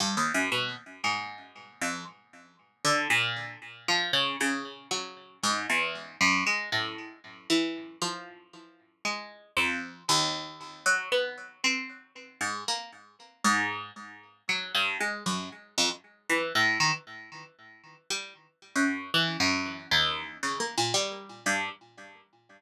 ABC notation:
X:1
M:7/8
L:1/16
Q:1/4=116
K:none
V:1 name="Pizzicato Strings"
(3G,,2 _E,,2 _G,,2 B,,2 z2 _A,,6 | F,,2 z6 D,2 _B,,4 | z2 F,2 _D,2 D,4 _G,4 | _A,,2 E,,4 _G,,2 _A,2 =A,,4 |
z2 E,4 F,8 | _A,4 F,,4 _E,,6 | _G,2 B,4 C6 _A,,2 | _B,2 z4 _A,,4 z4 |
_G,2 =G,,2 _A,2 _G,,2 z2 F,, z3 | E,2 A,,2 _E, z9 | G,2 z3 _G,,3 E,2 G,,4 | _E,,4 (3_D,2 _B,2 _B,,2 G,4 G,,2 |]